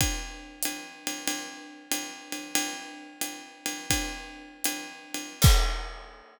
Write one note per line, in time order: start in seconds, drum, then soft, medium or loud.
0.01 kick medium
0.01 ride loud
0.63 hi-hat pedal medium
0.63 ride medium
1.07 ride medium
1.28 ride medium
1.91 hi-hat pedal medium
1.91 ride medium
2.32 ride medium
2.55 ride loud
3.21 hi-hat pedal medium
3.21 ride medium
3.66 ride medium
3.90 kick medium
3.90 ride loud
4.64 hi-hat pedal medium
4.64 ride medium
5.14 ride medium
5.42 kick loud
5.42 crash loud